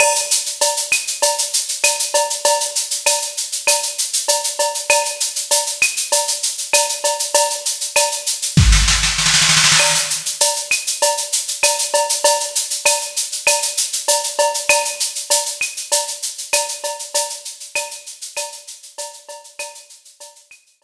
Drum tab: CC |x-------------------------------|--------------------------------|--------------------------------|--------------------------------|
SH |--x-x-x-x-x-x-x-x-x-x-x-x-x-x-x-|x-x-x-x-x-x-x-x-x-x-x-x-x-x-x-x-|x-x-x-x-x-x-x-x-x-x-x-x-x-x-x-x-|x-x-x-x-x-x-x-x-----------------|
CB |x-------x-------x-------x---x---|x-------x-------x-------x---x---|x-------x-------x-------x---x---|x-------x-----------------------|
CL |x-----------x-----------x-------|--------x-------x---------------|x-----------x-----------x-------|--------x-----------------------|
SD |--------------------------------|--------------------------------|--------------------------------|----------------o-o-o-o-oooooooo|
BD |--------------------------------|--------------------------------|--------------------------------|----------------o---------------|

CC |x-------------------------------|--------------------------------|--------------------------------|--------------------------------|
SH |--x-x-x-x-x-x-x-x-x-x-x-x-x-x-x-|x-x-x-x-x-x-x-x-x-x-x-x-x-x-x-x-|x-x-x-x-x-x-x-x-x-x-x-x-x-x-x-x-|x-x-x-x-x-x-x-x-x-x-x-x-x-x-x-x-|
CB |x-------x-------x-------x---x---|x-------x-------x-------x---x---|x-------x-------x-------x---x---|x-------x-------x-------x---x---|
CL |x-----------x-----------x-------|--------x-------x---------------|x-----------x-----------x-------|--------x-------x---------------|
SD |--------------------------------|--------------------------------|--------------------------------|--------------------------------|
BD |--------------------------------|--------------------------------|--------------------------------|--------------------------------|

CC |--------------------------------|
SH |x-x-x-x-x-x-x-x-x---------------|
CB |x-------x-------x---------------|
CL |x-----------x-------------------|
SD |--------------------------------|
BD |--------------------------------|